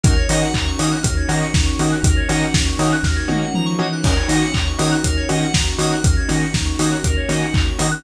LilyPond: <<
  \new Staff \with { instrumentName = "Lead 2 (sawtooth)" } { \time 4/4 \key ees \dorian \tempo 4 = 120 <bes des' ees' ges'>8 <bes des' ees' ges'>4 <bes des' ees' ges'>4 <bes des' ees' ges'>4 <bes des' ees' ges'>8~ | <bes des' ees' ges'>8 <bes des' ees' ges'>4 <bes des' ees' ges'>4 <bes des' ees' ges'>4 <bes des' ees' ges'>8 | <bes des' ees' ges'>8 <bes des' ees' ges'>4 <bes des' ees' ges'>4 <bes des' ees' ges'>4 <bes des' ees' ges'>8~ | <bes des' ees' ges'>8 <bes des' ees' ges'>4 <bes des' ees' ges'>4 <bes des' ees' ges'>4 <bes des' ees' ges'>8 | }
  \new Staff \with { instrumentName = "Electric Piano 2" } { \time 4/4 \key ees \dorian bes'16 des''16 ees''16 ges''16 bes''16 des'''16 ees'''16 ges'''16 bes'16 des''16 ees''16 ges''16 bes''16 des'''16 ees'''16 ges'''16 | bes'16 des''16 ees''16 ges''16 bes''16 des'''16 ees'''16 ges'''16 bes'16 des''16 ees''16 ges''16 bes''16 des'''16 ees'''16 ges'''16 | bes'16 des''16 ees''16 ges''16 bes''16 des'''16 ees'''16 ges'''16 bes'16 des''16 ees''16 ges''16 bes''16 des'''16 ees'''16 ges'''16 | bes'16 des''16 ees''16 ges''16 bes''16 des'''16 ees'''16 ges'''16 bes'16 des''16 ees''16 ges''16 bes''16 des'''16 ees'''16 ges'''16 | }
  \new Staff \with { instrumentName = "Synth Bass 2" } { \clef bass \time 4/4 \key ees \dorian ees,8 ees8 ees,8 ees8 ees,8 ees8 ees,8 ees8 | ees,8 ees8 ees,8 ees8 ees,8 ees8 f8 e8 | ees,8 ees8 ees,8 ees8 ees,8 ees8 ees,8 ees8 | ees,8 ees8 ees,8 ees8 ees,8 ees8 ees,8 ees8 | }
  \new Staff \with { instrumentName = "String Ensemble 1" } { \time 4/4 \key ees \dorian <bes des' ees' ges'>1~ | <bes des' ees' ges'>1 | <bes des' ees' ges'>1~ | <bes des' ees' ges'>1 | }
  \new DrumStaff \with { instrumentName = "Drums" } \drummode { \time 4/4 <hh bd>8 <hho sn>8 <hc bd>8 hho8 <hh bd>8 hho8 <bd sn>8 hho8 | <hh bd>8 <hho sn>8 <bd sn>8 hho8 <bd sn>8 tommh8 toml4 | <cymc bd>8 <hho sn>8 <hc bd>8 hho8 <hh bd>8 hho8 <bd sn>8 hho8 | <hh bd>8 <hho sn>8 <bd sn>8 hho8 <hh bd>8 hho8 <hc bd>8 hho8 | }
>>